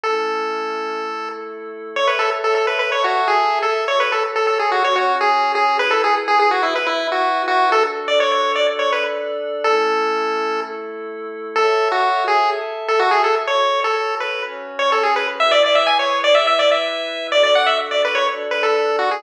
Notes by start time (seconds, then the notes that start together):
0.04 A3 C#4 E4 A4
1.00 A3 E4 A4
1.96 A4 C#5 E5
2.08 B4
2.19 A4
2.44 A4
2.55 A4
2.67 B4
2.79 B4
2.91 A4 C#5 E5 A5
3.04 F#4
3.28 G#4
3.62 A4
3.88 F#4 A4 C#5
4.00 B4
4.12 A4
4.36 A4
4.47 A4
4.59 G#4
4.72 F#4
4.83 C#4 F#4 C#5
4.96 F#4
5.21 G#4
5.55 G#4
5.79 E4 G#4 B4
5.91 A4
6.04 G#4
6.28 G#4
6.39 G#4
6.51 F#4
6.63 E4
6.75 E4 B4 E5
6.87 E4
7.12 F#4
7.48 F#4
7.71 D4 F#4 A4
8.08 D5
8.20 C#5
8.32 C#5
8.55 D5
8.68 D4 A4 D5
8.79 C#5
8.93 B4
9.64 A3 C#4 E4 A4
10.60 A3 E4 A4
11.56 A4 C#5 E5
11.92 F#4
12.28 G#4
12.51 A4 E5 A5
12.88 A4
13.00 F#4
13.11 G#4
13.24 A4
13.47 F#4 A4 C#5
13.84 A4
14.20 B4
14.43 C#4 F#4 C#5
14.79 C#5
14.92 A4
15.04 G#4
15.16 B4
15.39 E4 G#4 B4 E5
15.51 D5
15.64 D5
15.75 E5
15.87 G#5
15.99 C#5
16.24 D5
16.35 E4 B4 E5
16.47 E5
16.59 D5
16.71 E5
17.32 D4 F#4 A4 D5
17.43 D5
17.55 F#5
17.66 E5
17.91 D5
18.05 B4
18.15 C#5
18.28 D4 A4 D5
18.51 B4
18.63 A4
18.99 F#4
19.11 G#4